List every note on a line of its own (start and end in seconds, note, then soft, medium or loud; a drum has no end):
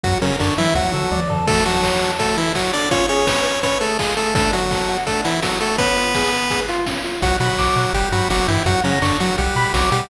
0.04 0.15 F#2 medium
0.04 0.18 F#3 medium
0.04 0.20 F#4 loud
0.04 0.18 F#4 medium
0.04 kick medium
0.04 closed hi-hat medium
0.22 0.36 C#3 medium
0.22 0.31 F#3 medium
0.22 0.36 C#4 medium
0.22 0.38 A#4 medium
0.22 snare soft
0.22 open hi-hat medium
0.40 0.51 F#2 medium
0.40 0.54 D3 medium
0.40 0.54 D4 medium
0.40 0.56 C#5 medium
0.40 kick medium
0.40 clap medium
0.58 0.74 E3 medium
0.58 0.68 F#3 medium
0.58 0.74 E4 medium
0.58 0.74 E5 medium
0.58 open hi-hat medium
0.75 0.85 D2 medium
0.75 1.21 F#3 medium
0.75 1.21 F#4 medium
0.75 0.92 F#4 medium
0.75 kick medium
0.75 high tom medium
0.93 1.04 D3 medium
0.93 1.10 A4 medium
1.11 1.21 D2 medium
1.11 1.28 D5 medium
1.11 high tom medium
1.29 1.40 D3 medium
1.29 1.46 A4 medium
1.29 floor tom medium
1.47 1.64 A3 medium
1.47 1.63 F#4 medium
1.47 1.64 A4 medium
1.47 kick loud
1.47 crash medium
1.57 closed hi-hat medium
1.65 2.11 F#3 medium
1.65 2.11 F#4 medium
1.65 1.82 A4 medium
1.65 open hi-hat medium
1.74 closed hi-hat medium
1.83 2.00 C#5 medium
1.83 kick medium
1.83 clap medium
1.92 closed hi-hat medium
2.01 2.18 A4 medium
2.01 open hi-hat medium
2.10 closed hi-hat medium
2.19 2.37 A3 medium
2.19 2.35 F#4 medium
2.19 2.37 A4 medium
2.19 kick medium
2.19 closed hi-hat medium
2.28 closed hi-hat medium
2.37 2.53 E3 medium
2.37 2.53 E4 medium
2.37 2.53 A4 medium
2.37 open hi-hat medium
2.46 closed hi-hat medium
2.55 2.72 F#3 medium
2.55 2.72 F#4 medium
2.55 2.71 C#5 medium
2.55 kick medium
2.55 clap medium
2.64 closed hi-hat medium
2.73 2.89 D4 medium
2.73 2.89 A4 medium
2.73 2.89 D5 medium
2.73 open hi-hat medium
2.82 closed hi-hat medium
2.91 3.06 C#4 medium
2.91 3.07 F4 medium
2.91 3.06 C#5 medium
2.91 kick medium
2.91 closed hi-hat medium
3.00 closed hi-hat medium
3.09 3.60 C#4 medium
3.09 3.25 G#4 medium
3.09 3.60 C#5 medium
3.09 open hi-hat medium
3.18 closed hi-hat medium
3.27 3.43 B4 medium
3.27 kick medium
3.27 snare loud
3.36 closed hi-hat medium
3.45 3.62 C#5 medium
3.45 open hi-hat medium
3.54 closed hi-hat medium
3.63 3.78 C#4 medium
3.63 3.79 B4 medium
3.63 3.78 C#5 medium
3.63 kick medium
3.63 closed hi-hat medium
3.72 closed hi-hat soft
3.81 3.98 A3 medium
3.81 3.97 G#4 medium
3.81 3.98 A4 medium
3.81 open hi-hat medium
3.90 closed hi-hat medium
3.99 4.15 G#3 medium
3.99 4.15 F4 medium
3.99 4.15 G#4 medium
3.99 kick medium
3.99 clap loud
4.08 closed hi-hat medium
4.17 4.34 A3 medium
4.17 4.33 G#4 medium
4.17 4.34 A4 medium
4.17 open hi-hat medium
4.26 closed hi-hat medium
4.35 4.51 A3 medium
4.35 4.51 D4 medium
4.35 4.51 A4 medium
4.35 kick loud
4.35 closed hi-hat medium
4.44 closed hi-hat medium
4.53 4.98 F#3 medium
4.53 4.98 F#4 medium
4.53 4.69 F#4 medium
4.53 open hi-hat medium
4.62 closed hi-hat medium
4.71 4.87 A4 medium
4.71 kick medium
4.71 snare medium
4.80 closed hi-hat medium
4.89 5.05 F#4 medium
4.89 open hi-hat medium
4.98 closed hi-hat medium
5.06 5.21 A3 medium
5.06 5.23 D4 medium
5.06 5.21 A4 medium
5.06 kick medium
5.06 closed hi-hat medium
5.16 closed hi-hat medium
5.24 5.40 E3 medium
5.24 5.40 E4 medium
5.24 5.41 F#4 medium
5.24 open hi-hat medium
5.34 closed hi-hat medium
5.42 5.59 F#3 medium
5.42 5.59 F#4 medium
5.42 5.59 A4 medium
5.42 kick medium
5.42 snare loud
5.52 closed hi-hat medium
5.60 5.76 A3 medium
5.60 5.77 F#4 medium
5.60 5.76 A4 medium
5.60 open hi-hat medium
5.70 closed hi-hat medium
5.78 6.60 B3 medium
5.78 5.95 C#4 medium
5.78 6.60 B4 medium
5.78 kick medium
5.78 closed hi-hat medium
5.87 closed hi-hat medium
5.96 6.13 F4 medium
5.96 open hi-hat medium
6.06 closed hi-hat medium
6.15 6.31 G#4 medium
6.15 kick medium
6.15 snare medium
6.23 closed hi-hat medium
6.32 6.49 B4 medium
6.32 open hi-hat medium
6.41 closed hi-hat medium
6.50 6.66 G#4 medium
6.50 kick medium
6.50 closed hi-hat medium
6.60 closed hi-hat medium
6.68 6.85 F4 medium
6.68 open hi-hat medium
6.77 closed hi-hat medium
6.86 7.03 C#4 medium
6.86 kick medium
6.86 snare medium
6.95 closed hi-hat medium
7.04 7.20 F4 medium
7.04 open hi-hat medium
7.13 closed hi-hat medium
7.22 7.32 B1 medium
7.22 7.37 F#3 medium
7.22 7.37 F#4 medium
7.22 7.39 F#5 loud
7.22 kick medium
7.22 closed hi-hat medium
7.40 7.50 B2 medium
7.40 7.93 F#3 medium
7.40 7.93 F#4 medium
7.40 7.56 B5 medium
7.40 snare soft
7.40 open hi-hat medium
7.58 7.68 B1 medium
7.58 7.75 D6 medium
7.58 kick medium
7.58 clap medium
7.76 7.86 B2 medium
7.76 7.92 F#5 medium
7.76 open hi-hat medium
7.93 8.03 G1 medium
7.93 8.09 G3 medium
7.93 8.09 G4 medium
7.93 8.11 G5 loud
7.93 kick medium
7.93 closed hi-hat medium
8.12 8.22 G2 medium
8.12 8.29 F#3 medium
8.12 8.29 F#4 medium
8.12 8.28 B5 medium
8.12 open hi-hat medium
8.30 8.40 G1 medium
8.30 8.47 F#3 medium
8.30 8.47 F#4 medium
8.30 8.46 D6 medium
8.30 kick medium
8.30 snare medium
8.48 8.58 G2 medium
8.48 8.63 E3 medium
8.48 8.63 E4 medium
8.48 8.64 G5 medium
8.48 open hi-hat medium
8.66 8.76 F#2 medium
8.66 8.81 F#3 medium
8.66 8.81 F#4 medium
8.66 8.82 F#5 loud
8.66 kick medium
8.66 closed hi-hat medium
8.84 8.99 C#3 medium
8.84 8.94 F#3 medium
8.84 8.99 C#4 medium
8.84 9.00 A#5 medium
8.84 snare soft
8.84 open hi-hat medium
9.02 9.12 F#2 medium
9.02 9.18 D3 medium
9.02 9.18 D4 medium
9.02 9.18 C#6 medium
9.02 kick medium
9.02 clap medium
9.20 9.36 F#3 medium
9.20 9.31 F#3 medium
9.20 9.36 F#4 medium
9.20 9.36 F#5 medium
9.20 open hi-hat medium
9.38 9.49 B1 medium
9.38 9.73 G3 medium
9.38 9.73 G4 medium
9.38 9.54 F#5 loud
9.38 kick medium
9.38 closed hi-hat medium
9.56 9.65 B2 medium
9.56 9.72 B5 medium
9.56 open hi-hat medium
9.74 9.84 B1 medium
9.74 9.90 F#3 medium
9.74 9.90 F#4 medium
9.74 9.90 D6 medium
9.74 kick medium
9.74 snare medium
9.92 10.02 B2 medium
9.92 10.09 G3 medium
9.92 10.09 G4 medium
9.92 10.08 F#5 medium
9.92 open hi-hat medium